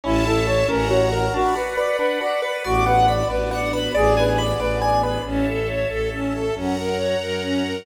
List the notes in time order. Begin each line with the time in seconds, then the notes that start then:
0.04 A1 C#4 E4 C#5 E5 A5
0.25 E4 A4
0.47 A4 C#5
0.68 A1 C#4 A#4 C#5 F#5 A#5
0.89 F#4 C#5
1.12 A#4
1.34 D4 F#4 D5 F#5 B5
1.56 F#4 B4
1.77 B4 D5
1.99 D4 B4
2.21 F#4 D5
2.42 B4
2.64 A1 B3 D4 F#4 D5
2.86 B4 F#5
3.08 D5 B5
3.29 A1 B4 D5
3.51 D5 F#5
3.72 B4 B5
3.95 A1 B3 D4 G#4 D5
4.17 B4 G#5
4.38 D5 B5
4.60 A1 B4 D5
4.82 D5 G#5
5.02 B4 B5
5.25 A1 C#4 C#5 E5 A5
5.48 A4
5.68 C#5
5.89 A1 A4
6.14 C#4
6.34 A4
6.55 F#2 C#4 C#5 F#5 A#5
6.78 A#4
6.97 C#5
7.21 F#2 A#4
7.43 C#4
7.66 A#4